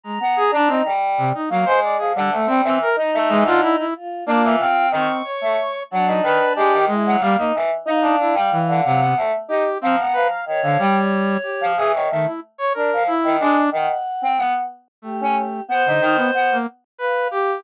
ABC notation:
X:1
M:6/8
L:1/16
Q:3/8=61
K:none
V:1 name="Choir Aahs"
z B, z D ^D G,3 z ^A, ^G,2 | F, D, A, G, E, z ^D A, E, =D, z2 | z2 D E, C2 ^D, z2 A, z2 | ^F, ^D ^D, z ^G, D, z F, ^A, D E, z |
^D =D D G, z D, ^F, B, A, z ^D z | F, B, F, z ^D, F, G, z4 F, | E, ^D, A, z3 =D F, z ^D, ^G, z | ^D, z2 C B, z4 ^C z2 |
B, ^D ^D, z B, z7 |]
V:2 name="Choir Aahs"
^a6 z6 | z6 ^D6 | F2 F4 ^c'6 | D6 E2 z4 |
f8 z4 | ^a4 ^c8 | z12 | ^f4 z4 G4 |
c6 z2 f4 |]
V:3 name="Brass Section"
^G, z ^G D C z2 C, ^D ^F, c =d | ^G =G, A, C C ^A z2 ^G, F E E | z2 ^A,2 f2 C2 ^c4 | ^F,2 B2 G2 ^G,2 =G, ^A, z2 |
^D2 E z E,2 C,2 z2 G2 | C z B f z D, G,4 G2 | ^G ^c ^D, E z c ^A2 E2 =D2 | z8 A,4 |
z D, ^D B, z ^A, z2 B2 G2 |]